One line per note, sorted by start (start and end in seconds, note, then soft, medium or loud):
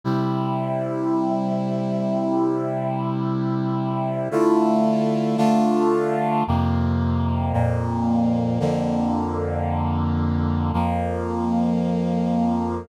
0.04 4.29 C3 medium
0.04 4.29 G3 medium
0.04 4.29 E4 medium
4.31 5.37 D3 medium
4.31 5.37 A3 loud
4.31 5.37 E4 loud
4.31 5.37 F4 loud
5.37 6.43 D3 medium
5.37 6.43 A3 loud
5.37 6.43 D4 loud
5.37 6.43 F4 loud
6.47 7.53 F2 loud
6.47 7.53 C3 medium
6.47 7.53 A#3 loud
7.53 8.59 F2 loud
7.53 8.59 A#2 loud
7.53 8.59 A#3 medium
8.60 10.72 F2 loud
8.60 10.72 D3 loud
8.60 10.72 A#3 medium
10.73 12.86 F2 medium
10.73 12.86 F3 medium
10.73 12.86 A#3 loud